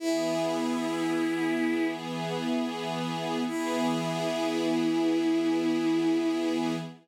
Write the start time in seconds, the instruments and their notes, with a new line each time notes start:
0.00 string ensemble 1 E3 B3 G#4, violin E4
3.47 string ensemble 1 E3 B3 G#4, violin E4